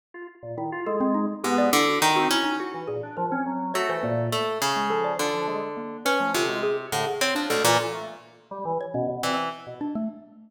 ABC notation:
X:1
M:9/8
L:1/16
Q:3/8=69
K:none
V:1 name="Orchestral Harp"
z10 ^G,,2 D,2 ^D,2 ^C2 | z8 A,4 A,2 ^C,4 | D,6 ^C2 =C,4 A,, z =C F, D,, ^A,, | z10 E,2 z6 |]
V:2 name="Xylophone"
z4 E z A C ^D z G =d E ^F ^D F E D | ^F z ^G z ^A C3 ^c =c ^A,3 z2 ^G, =A d | z4 ^A,2 B =A, F ^F ^G z2 G ^c D A z | A2 z5 ^c ^C z d z3 D A, z2 |]
V:3 name="Drawbar Organ"
z F z ^A,, ^D, F ^G,3 z B,2 z3 C z2 | ^F E, ^A,, D =F, ^C ^F,2 F E, A,,2 z4 =F,2 | F F, ^G, z4 F, D, G, z2 D, z2 D B,, E, | z A, z3 G, E, z B,, B,, C z2 B,, z4 |]